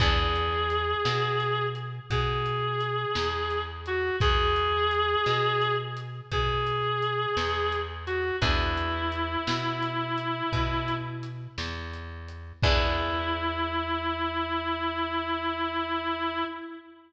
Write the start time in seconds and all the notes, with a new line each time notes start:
0.00 E2 B3 D4 E4 G#4, kick, closed hi-hat
0.35 closed hi-hat
0.70 closed hi-hat
1.05 B2, snare
1.40 closed hi-hat
1.75 closed hi-hat
2.10 B2 G#4, kick, closed hi-hat
2.46 closed hi-hat
2.81 closed hi-hat
3.15 E2, snare
3.50 closed hi-hat
3.86 F#4, closed hi-hat
4.20 E2 G#4, kick, closed hi-hat
4.56 closed hi-hat
4.91 closed hi-hat
5.26 B2, snare
5.62 closed hi-hat
5.97 closed hi-hat
6.31 B2 G#4, kick, closed hi-hat
6.67 closed hi-hat
7.02 closed hi-hat
7.37 E2, snare
7.72 closed hi-hat
8.07 F#4, closed hi-hat
8.41 E2 B3 D4 E4 G#4, kick, closed hi-hat
8.77 closed hi-hat
9.12 closed hi-hat
9.47 B2, snare
9.82 closed hi-hat
10.18 closed hi-hat
10.52 B2, kick, closed hi-hat
10.88 closed hi-hat
11.23 closed hi-hat
11.58 E2, snare
11.93 closed hi-hat
12.29 closed hi-hat
12.63 E2 B3 D4 E4 G#4, kick, crash